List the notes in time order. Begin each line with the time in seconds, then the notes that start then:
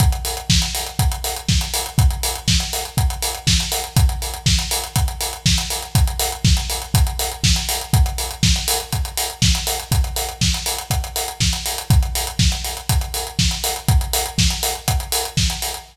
0.00 kick, closed hi-hat
0.12 closed hi-hat
0.25 open hi-hat
0.37 closed hi-hat
0.50 kick, snare
0.62 closed hi-hat
0.75 open hi-hat
0.86 closed hi-hat
0.99 kick, closed hi-hat
1.12 closed hi-hat
1.24 open hi-hat
1.36 closed hi-hat
1.49 kick, snare
1.61 closed hi-hat
1.74 open hi-hat
1.86 closed hi-hat
1.98 kick, closed hi-hat
2.11 closed hi-hat
2.23 open hi-hat
2.35 closed hi-hat
2.48 kick, snare
2.60 closed hi-hat
2.73 open hi-hat
2.85 closed hi-hat
2.97 kick, closed hi-hat
3.10 closed hi-hat
3.22 open hi-hat
3.35 closed hi-hat
3.47 kick, snare
3.60 closed hi-hat
3.72 open hi-hat
3.84 closed hi-hat
3.96 kick, closed hi-hat
4.09 closed hi-hat
4.22 open hi-hat
4.34 closed hi-hat
4.46 kick, snare
4.59 closed hi-hat
4.71 open hi-hat
4.84 closed hi-hat
4.96 kick, closed hi-hat
5.08 closed hi-hat
5.21 open hi-hat
5.33 closed hi-hat
5.46 kick, snare
5.58 closed hi-hat
5.70 open hi-hat
5.82 closed hi-hat
5.95 kick, closed hi-hat
6.07 closed hi-hat
6.20 open hi-hat
6.32 closed hi-hat
6.45 kick, snare
6.57 closed hi-hat
6.70 open hi-hat
6.82 closed hi-hat
6.94 kick, closed hi-hat
7.07 closed hi-hat
7.19 open hi-hat
7.32 closed hi-hat
7.44 kick, snare
7.56 closed hi-hat
7.69 open hi-hat
7.81 closed hi-hat
7.93 kick, closed hi-hat
8.06 closed hi-hat
8.18 open hi-hat
8.31 closed hi-hat
8.43 kick, snare
8.56 closed hi-hat
8.68 open hi-hat
8.80 closed hi-hat
8.92 kick, closed hi-hat
9.05 closed hi-hat
9.17 open hi-hat
9.30 closed hi-hat
9.42 kick, snare
9.55 closed hi-hat
9.67 open hi-hat
9.80 closed hi-hat
9.92 kick, closed hi-hat
10.04 closed hi-hat
10.16 open hi-hat
10.29 closed hi-hat
10.41 kick, snare
10.54 closed hi-hat
10.66 open hi-hat
10.78 closed hi-hat
10.90 kick, closed hi-hat
11.04 closed hi-hat
11.16 open hi-hat
11.28 closed hi-hat
11.40 kick, snare
11.53 closed hi-hat
11.66 open hi-hat
11.78 closed hi-hat
11.90 kick, closed hi-hat
12.03 closed hi-hat
12.15 open hi-hat
12.27 closed hi-hat
12.39 kick, snare
12.52 closed hi-hat
12.64 open hi-hat
12.77 closed hi-hat
12.89 kick, closed hi-hat
13.01 closed hi-hat
13.14 open hi-hat
13.27 closed hi-hat
13.39 kick, snare
13.51 closed hi-hat
13.64 open hi-hat
13.76 closed hi-hat
13.88 kick, closed hi-hat
14.01 closed hi-hat
14.13 open hi-hat
14.26 closed hi-hat
14.38 kick, snare
14.50 closed hi-hat
14.63 open hi-hat
14.75 closed hi-hat
14.88 kick, closed hi-hat
15.00 closed hi-hat
15.12 open hi-hat
15.25 closed hi-hat
15.37 kick, snare
15.50 closed hi-hat
15.62 open hi-hat
15.74 closed hi-hat